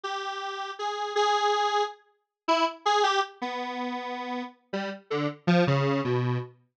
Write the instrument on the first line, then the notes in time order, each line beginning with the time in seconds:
lead 1 (square)
0.04 G4
0.79 G#4
1.16 G#4
2.48 E4
2.85 G#4
3.03 G4
3.42 B3
4.73 G3
5.10 D3
5.47 F3
5.67 C#3
6.04 B2